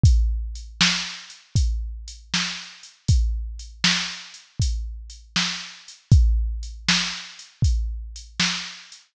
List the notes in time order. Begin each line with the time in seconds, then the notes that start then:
0.03 kick, closed hi-hat
0.55 closed hi-hat
0.81 snare
1.30 closed hi-hat
1.55 kick, closed hi-hat
2.08 closed hi-hat
2.34 snare
2.83 closed hi-hat
3.08 kick, closed hi-hat
3.59 closed hi-hat
3.84 snare
4.34 closed hi-hat
4.59 kick, closed hi-hat
5.10 closed hi-hat
5.36 snare
5.88 closed hi-hat
6.11 kick, closed hi-hat
6.63 closed hi-hat
6.89 snare
7.39 closed hi-hat
7.62 kick, closed hi-hat
8.16 closed hi-hat
8.40 snare
8.92 closed hi-hat